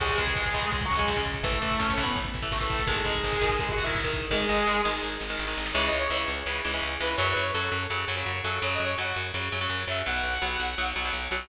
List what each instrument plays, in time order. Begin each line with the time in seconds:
0.00 electric bass (finger) C#2, overdriven guitar C#3 G#3, distortion guitar G#3 G#4, kick, crash
0.09 kick
0.18 electric bass (finger) C#2, overdriven guitar C#3 G#3, distortion guitar G#3 G#4, kick, closed hi-hat
0.27 kick
0.36 electric bass (finger) C#2, kick, snare
0.46 kick
0.54 electric bass (finger) C#2, overdriven guitar C#3 G#3, kick, closed hi-hat
0.62 kick
0.71 electric bass (finger) C#2, distortion guitar G#3 G#4, kick, closed hi-hat
0.81 kick
0.85 distortion guitar F#3 F#4, closed hi-hat
0.90 electric bass (finger) C#2, kick
0.96 overdriven guitar C#3 G#3, distortion guitar G#3 G#4, kick
1.07 electric bass (finger) C#2, kick, snare
1.16 overdriven guitar C#3 G#3, kick
1.26 electric bass (finger) C#2, kick, closed hi-hat
1.34 kick
1.43 electric bass (finger) A1, overdriven guitar E3 A3, distortion guitar A3 A4, kick, closed hi-hat
1.52 kick
1.62 electric bass (finger) A1, overdriven guitar E3 A3, kick, closed hi-hat
1.71 kick
1.79 electric bass (finger) A1, distortion guitar C#4 C#5, kick, snare
1.90 distortion guitar C#4 C#5, kick
1.97 electric bass (finger) A1, overdriven guitar E3 A3, kick, closed hi-hat
2.03 distortion guitar B3 B4, kick
2.15 electric bass (finger) A1, kick, closed hi-hat
2.25 kick
2.33 electric bass (finger) A1, kick, closed hi-hat
2.42 overdriven guitar E3 A3, kick
2.51 electric bass (finger) A1, distortion guitar A3 A4, kick, snare
2.60 overdriven guitar E3 A3, kick
2.70 electric bass (finger) A1, kick, closed hi-hat
2.79 kick
2.87 electric bass (finger) G#1, overdriven guitar D#3 G#3, distortion guitar G#3 G#4, kick, closed hi-hat
2.96 kick
3.05 electric bass (finger) G#1, overdriven guitar D#3 G#3, distortion guitar G#3 G#4, kick, closed hi-hat
3.15 kick
3.24 electric bass (finger) G#1, kick, snare
3.33 kick
3.41 electric bass (finger) G#1, overdriven guitar D#3 G#3, kick, closed hi-hat
3.50 kick
3.59 electric bass (finger) G#1, distortion guitar G#3 G#4, kick, closed hi-hat
3.69 distortion guitar F#4 F#5, kick
3.77 electric bass (finger) G#1, kick, closed hi-hat
3.84 overdriven guitar D#3 G#3, distortion guitar E4 E5, kick
3.95 electric bass (finger) G#1, kick, snare
4.04 overdriven guitar D#3 G#3, kick
4.13 electric bass (finger) G#1, kick, closed hi-hat
4.22 kick
4.31 electric bass (finger) G#1, overdriven guitar D#3 G#3, distortion guitar G#3 G#4, kick, snare
4.49 electric bass (finger) G#1, overdriven guitar D#3 G#3, snare
4.67 electric bass (finger) G#1, snare
4.85 electric bass (finger) G#1, overdriven guitar D#3 G#3, snare
5.03 electric bass (finger) G#1, snare
5.11 snare
5.20 electric bass (finger) G#1, snare
5.29 overdriven guitar D#3 G#3, snare
5.38 electric bass (finger) G#1, snare
5.48 overdriven guitar D#3 G#3, snare
5.57 electric bass (finger) G#1, snare
5.66 snare
5.73 electric bass (finger) C#2, overdriven guitar C#3 E3 G#3, lead 2 (sawtooth) C#5
5.86 lead 2 (sawtooth) D#5
5.93 electric bass (finger) C#2
5.99 lead 2 (sawtooth) C#5
6.10 electric bass (finger) C#2, overdriven guitar C#3 E3 G#3, lead 2 (sawtooth) C#5
6.28 electric bass (finger) C#2
6.46 electric bass (finger) C#2, overdriven guitar C#3 E3 G#3
6.64 electric bass (finger) C#2, overdriven guitar C#3 E3 G#3
6.74 overdriven guitar C#3 E3 G#3
6.82 electric bass (finger) C#2
7.00 electric bass (finger) C#2, overdriven guitar C#3 E3 G#3, lead 2 (sawtooth) B4
7.17 electric bass (finger) F#2, overdriven guitar C#3 F#3, lead 2 (sawtooth) C#5
7.32 lead 2 (sawtooth) B4
7.36 electric bass (finger) F#2
7.42 lead 2 (sawtooth) C#5
7.53 electric bass (finger) F#2, overdriven guitar C#3 F#3, lead 2 (sawtooth) A4
7.72 electric bass (finger) F#2
7.90 electric bass (finger) F#2, overdriven guitar C#3 F#3
8.08 electric bass (finger) F#2, overdriven guitar C#3 F#3
8.17 overdriven guitar C#3 F#3
8.26 electric bass (finger) F#2
8.43 electric bass (finger) F#2, overdriven guitar C#3 F#3, lead 2 (sawtooth) A4
8.62 electric bass (finger) F#2, overdriven guitar C#3 F#3, lead 2 (sawtooth) C#5
8.74 lead 2 (sawtooth) D#5
8.80 electric bass (finger) F#2
8.85 lead 2 (sawtooth) C#5
8.98 electric bass (finger) F#2, overdriven guitar C#3 F#3, lead 2 (sawtooth) F#5
9.16 electric bass (finger) F#2
9.34 electric bass (finger) F#2, overdriven guitar C#3 F#3
9.52 electric bass (finger) F#2, overdriven guitar C#3 F#3
9.61 overdriven guitar C#3 F#3
9.70 electric bass (finger) F#2
9.87 electric bass (finger) F#2, overdriven guitar C#3 F#3, lead 2 (sawtooth) E5
10.06 electric bass (finger) B1, overdriven guitar B2 F#3, lead 2 (sawtooth) F#5
10.23 electric bass (finger) B1
10.42 electric bass (finger) B1, overdriven guitar B2 F#3
10.60 electric bass (finger) B1
10.78 electric bass (finger) B1, overdriven guitar B2 F#3
10.96 electric bass (finger) B1, overdriven guitar B2 F#3
11.05 overdriven guitar B2 F#3
11.13 electric bass (finger) B1
11.31 electric bass (finger) B1, overdriven guitar B2 F#3